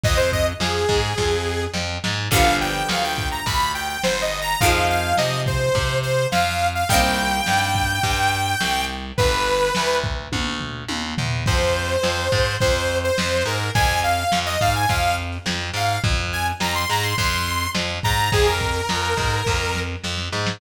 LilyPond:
<<
  \new Staff \with { instrumentName = "Lead 2 (sawtooth)" } { \time 4/4 \key f \dorian \tempo 4 = 105 ees''16 c''16 ees''16 r16 aes'2 r4 | \key c \dorian f''8 g''8 f''16 g''8 ais''16 b''8 g''16 g''16 \tuplet 3/2 { c''8 ees''8 bes''8 } | f''8 f''8 ees''8 c''4 c''8 f''8. f''16 | g''1 |
b'4. r2 r8 | \key f \dorian c''2 c''8. c''8. bes'8 | aes''8 f''8. ees''16 f''16 aes''16 f''8 r4 f''8 | r8 aes''16 r16 bes''16 c'''16 bes''16 c'''16 c'''4 r8 bes''8 |
aes'16 bes'2~ bes'8. r4 | }
  \new Staff \with { instrumentName = "Acoustic Guitar (steel)" } { \time 4/4 \key f \dorian r1 | \key c \dorian <d f g b>1 | <ees f aes c'>1 | <ees g bes c'>1 |
r1 | \key f \dorian r1 | r1 | r1 |
r1 | }
  \new Staff \with { instrumentName = "Electric Bass (finger)" } { \clef bass \time 4/4 \key f \dorian f,4 f,8 aes,8 f,4 f,8 aes,8 | \key c \dorian g,,4 d,4 d,4 g,,4 | f,4 c4 c4 f,4 | c,4 g,4 g,4 c,4 |
g,,4 d,4 d,4 ees,8 e,8 | \key f \dorian f,4 f,8 aes,8 f,4 f,8 aes,8 | f,4 f,8 aes,8 f,4 f,8 aes,8 | f,4 f,8 aes,8 f,4 f,8 aes,8 |
f,4 f,8 aes,8 f,4 f,8 aes,8 | }
  \new DrumStaff \with { instrumentName = "Drums" } \drummode { \time 4/4 <hh bd>16 hh16 <hh bd>16 hh16 sn16 hh16 <hh bd>16 hh16 <bd sn>4 sn8 sn8 | <cymc bd>8 hh8 sn8 <hh bd>8 <hh bd>8 hh8 sn8 hh8 | <hh bd>8 hh8 sn8 <hh bd>8 <hh bd>8 hh8 sn8 hh8 | <hh bd>8 hh8 sn8 <hh bd>8 <hh bd>8 hh8 sn8 hh8 |
<hh bd>8 hh8 sn8 <hh bd>8 <bd tommh>8 tomfh8 tommh8 tomfh8 | <cymc bd>16 hh16 hh16 hh16 sn16 hh16 <hh bd>16 hh16 <hh bd>16 hh16 hh16 hh16 sn16 hh16 hh16 hh16 | <hh bd>16 hh16 hh16 hh16 sn16 hh16 <hh bd>16 hh16 <hh bd>16 hh16 hh16 hh16 sn16 hh16 hh16 hh16 | <hh bd>16 hh16 hh16 hh16 sn16 hh16 hh16 hh16 <hh bd>16 hh16 hh16 hh16 sn16 hh16 <hh bd>16 hh16 |
<hh bd>16 hh16 <hh bd>16 hh16 sn16 hh16 <hh bd>16 hh16 <bd sn>8 sn8 sn16 sn16 sn16 sn16 | }
>>